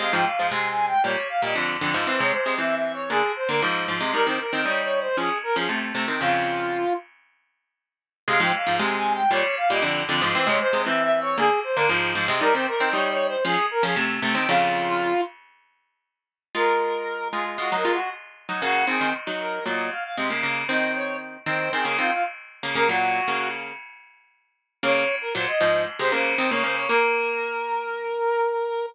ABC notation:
X:1
M:4/4
L:1/16
Q:1/4=116
K:Fm
V:1 name="Brass Section"
f g f2 (3a2 a2 g2 d2 f e z4 | c d c2 (3=e2 e2 d2 A2 c B z4 | B c B2 (3d2 d2 c2 A2 B A z4 | F6 z10 |
f g f2 (3a2 a2 g2 d2 f e z4 | c d c2 (3=e2 e2 d2 A2 c B z4 | B c B2 (3d2 d2 c2 A2 B A z4 | F6 z10 |
[K:Bbm] B6 A z (3G2 B2 G2 z4 | G2 A2 z2 B2 e2 f f z4 | e2 d2 z2 c2 A2 F F z4 | B G5 z10 |
d3 B c e3 z c c2 c d c d | B16 |]
V:2 name="Pizzicato Strings"
[C,A,] [A,,F,] z [A,,F,] [C,A,]4 [B,,G,] z2 [B,,G,] [F,,=D,]2 [F,,D,] [A,,F,] | [=E,C] [C,A,] z [C,A,] [E,C]4 [=D,B,] z2 [D,B,] [A,,F,]2 [A,,F,] [C,A,] | [G,E] [E,C] z [E,C] [G,E]4 [F,D] z2 [F,D] [C,=A,]2 [C,A,] [E,C] | [F,,D,]6 z10 |
[C,A,] [A,,F,] z [A,,F,] [C,A,]4 [B,,G,] z2 [B,,G,] [F,,=D,]2 [F,,D,] [A,,F,] | [=E,C] [C,A,] z [C,A,] [E,C]4 [=D,B,] z2 [D,B,] [A,,F,]2 [A,,F,] [C,A,] | [G,E] [E,C] z [E,C] [G,E]4 [F,D] z2 [F,D] [C,=A,]2 [C,A,] [E,C] | [F,,D,]6 z10 |
[K:Bbm] [A,F]6 [A,F]2 [A,F] [G,E] [A,F] z4 [G,E] | [D,B,]2 [E,C] [E,C] z [G,E]3 [B,,G,]2 z2 [C,A,] [D,B,] [D,B,]2 | [E,C]6 [E,C]2 [E,C] [D,B,] [E,C] z4 [D,B,] | [D,B,] [B,,G,]3 [D,B,]4 z8 |
[D,B,]2 z2 [B,,G,] z [A,,F,]2 z [C,A,] [D,B,]2 [E,C] [D,B,] [D,B,]2 | B,16 |]